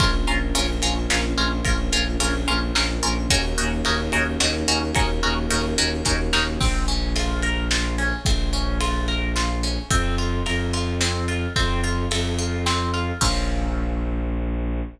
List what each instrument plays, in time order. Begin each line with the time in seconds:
0.00 violin A#1, choir aahs A#3 C#4 F4, orchestral harp C#4 F4 A#4, kick, ride
0.27 violin A#1, orchestral harp C#4 F4 A#4, ride
0.55 violin A#1, orchestral harp C#4 F4 A#4, ride
0.82 violin A#1, orchestral harp C#4 F4 A#4, ride
1.10 violin A#1, orchestral harp C#4 F4 A#4, snare
1.38 violin A#1, orchestral harp C#4 F4 A#4, ride
1.65 violin A#1, orchestral harp C#4 F4 A#4, kick, ride
1.92 violin A#1, orchestral harp C#4 F4 A#4, ride
2.20 violin A#1, orchestral harp C#4 F4 A#4, ride
2.48 violin A#1, orchestral harp C#4 F4 A#4, ride
2.75 violin A#1, orchestral harp C#4 F4 A#4, snare
3.03 violin A#1, orchestral harp C#4 F4 A#4, ride
3.30 violin D#2, choir aahs A#3 C#4 D#4 F#4, orchestral harp C#4 D#4 F#4 A#4, kick, ride
3.58 violin D#2, orchestral harp C#4 D#4 F#4 A#4, ride
3.85 violin D#2, orchestral harp C#4 D#4 F#4 A#4, ride
4.12 violin D#2, orchestral harp C#4 D#4 F#4 A#4, ride
4.40 violin D#2, orchestral harp C#4 D#4 F#4 A#4, snare
4.68 violin D#2, orchestral harp C#4 D#4 F#4 A#4, ride
4.95 violin D#2, choir aahs A#3 C#4 F#4 A#4, orchestral harp C#4 D#4 F#4 A#4, kick, ride
5.23 violin D#2, orchestral harp C#4 D#4 F#4 A#4, ride
5.50 violin D#2, orchestral harp C#4 D#4 F#4 A#4, ride
5.78 violin D#2, orchestral harp C#4 D#4 F#4 A#4, ride
6.05 violin D#2, orchestral harp C#4 D#4 F#4 A#4, kick, snare
6.33 violin D#2, orchestral harp C#4 D#4 F#4 A#4, snare
6.60 violin A#1, orchestral harp C4, kick, crash
6.88 orchestral harp C#4, ride
7.16 orchestral harp F4, ride
7.42 orchestral harp A#4, ride
7.71 orchestral harp F4, snare
7.98 orchestral harp C#4, ride
8.25 violin A#1, orchestral harp C4, kick, ride
8.53 orchestral harp C#4, ride
8.81 orchestral harp F4, ride
9.08 orchestral harp A#4, ride
9.36 orchestral harp F4, snare
9.63 orchestral harp C#4, ride
9.90 violin F2, orchestral harp C4, kick, ride
10.18 orchestral harp F4, ride
10.46 violin F2, orchestral harp A#4, ride
10.73 orchestral harp F4, ride
11.01 orchestral harp C4, snare
11.28 orchestral harp F4, ride
11.56 violin F2, orchestral harp C4, kick, ride
11.83 orchestral harp F4, ride
12.11 violin F2, orchestral harp A4, ride
12.39 orchestral harp F4, ride
12.66 orchestral harp C4, snare
12.94 orchestral harp F4, ride
13.21 violin A#1, orchestral harp C4 C#4 F4 A#4, kick, crash